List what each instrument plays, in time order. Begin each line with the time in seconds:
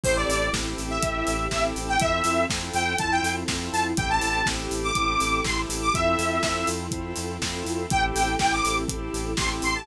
0.03 synth bass 1 A1, drawbar organ C4 E4 G4 A4, string ensemble 1 C4 E4 G4 A4, lead 2 (sawtooth) C5, kick, crash
0.16 lead 2 (sawtooth) D5
0.29 synth bass 1 A1, lead 2 (sawtooth) D5, open hi-hat
0.53 synth bass 1 A1, drawbar organ C4 E4 G4 A4, kick, snare
0.78 synth bass 1 A1, open hi-hat
0.90 lead 2 (sawtooth) E5
1.02 synth bass 1 A1, drawbar organ C4 E4 G4 A4, kick, closed hi-hat
1.27 synth bass 1 A1, open hi-hat
1.51 synth bass 1 A1, drawbar organ C4 E4 G4 A4, lead 2 (sawtooth) E5, kick, snare
1.76 synth bass 1 A1, open hi-hat
1.88 lead 2 (sawtooth) G5
1.99 synth bass 1 F2, string ensemble 1 C4 E4 F4 A4, drawbar organ C4 E4 F4 A4, lead 2 (sawtooth) E5, kick, closed hi-hat
2.24 synth bass 1 F2, open hi-hat
2.49 synth bass 1 F2, drawbar organ C4 E4 F4 A4, kick, snare
2.73 synth bass 1 F2, lead 2 (sawtooth) G5, open hi-hat
2.98 synth bass 1 F2, drawbar organ C4 E4 F4 A4, lead 2 (sawtooth) A5, kick, closed hi-hat
3.11 lead 2 (sawtooth) G5
3.23 synth bass 1 F2, open hi-hat
3.48 synth bass 1 F2, drawbar organ C4 E4 F4 A4, kick, snare
3.73 synth bass 1 F2, lead 2 (sawtooth) A5, open hi-hat
3.97 synth bass 1 A1, drawbar organ C4 E4 G4 A4, string ensemble 1 C4 E4 G4 A4, lead 2 (sawtooth) G5, kick, closed hi-hat
4.10 lead 2 (sawtooth) A5
4.21 synth bass 1 A1, lead 2 (sawtooth) A5, open hi-hat
4.46 synth bass 1 A1, drawbar organ C4 E4 G4 A4, kick, snare
4.71 synth bass 1 A1, open hi-hat
4.84 lead 2 (sawtooth) D6
4.95 synth bass 1 A1, drawbar organ C4 E4 G4 A4, kick, closed hi-hat
5.20 synth bass 1 A1, open hi-hat
5.44 synth bass 1 A1, drawbar organ C4 E4 G4 A4, lead 2 (sawtooth) C6, kick, snare
5.69 synth bass 1 A1, open hi-hat
5.82 lead 2 (sawtooth) D6
5.94 synth bass 1 F2, drawbar organ C4 E4 F4 A4, string ensemble 1 C4 E4 F4 A4, lead 2 (sawtooth) E5, kick, closed hi-hat
6.19 synth bass 1 F2, open hi-hat
6.42 synth bass 1 F2, drawbar organ C4 E4 F4 A4, kick, snare
6.67 synth bass 1 F2, open hi-hat
6.91 synth bass 1 F2, drawbar organ C4 E4 F4 A4, kick, closed hi-hat
7.16 synth bass 1 F2, open hi-hat
7.42 synth bass 1 F2, drawbar organ C4 E4 F4 A4, kick, snare
7.65 synth bass 1 F2, open hi-hat
7.90 synth bass 1 A1, string ensemble 1 C4 E4 G4 A4, drawbar organ C4 E4 G4 A4, lead 2 (sawtooth) G5, kick, closed hi-hat
8.15 synth bass 1 A1, lead 2 (sawtooth) G5, open hi-hat
8.39 synth bass 1 A1, drawbar organ C4 E4 G4 A4, lead 2 (sawtooth) G5, kick, snare
8.52 lead 2 (sawtooth) D6
8.65 synth bass 1 A1, open hi-hat
8.88 synth bass 1 A1, drawbar organ C4 E4 G4 A4, kick, closed hi-hat
9.14 synth bass 1 A1, open hi-hat
9.37 synth bass 1 A1, drawbar organ C4 E4 G4 A4, lead 2 (sawtooth) C6, kick, snare
9.62 synth bass 1 A1, lead 2 (sawtooth) C6, open hi-hat
9.75 lead 2 (sawtooth) A5